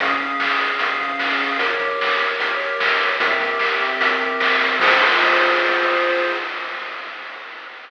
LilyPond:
<<
  \new Staff \with { instrumentName = "Lead 1 (square)" } { \time 4/4 \key f \minor \tempo 4 = 150 <des' aes' f''>1 | <g' bes' des''>1 | <c' g' bes' e''>1 | <f' aes' c''>1 | }
  \new DrumStaff \with { instrumentName = "Drums" } \drummode { \time 4/4 <hh bd>8 <hh bd>8 sn8 hh8 <hh bd>8 <hh bd>8 sn8 hho8 | <hh bd>8 <hh bd>8 sn8 hh8 <hh bd>8 hh8 sn8 hh8 | <hh bd>8 <hh bd>8 sn8 hh8 <hh bd>8 <hh bd>8 sn8 hho8 | <cymc bd>4 r4 r4 r4 | }
>>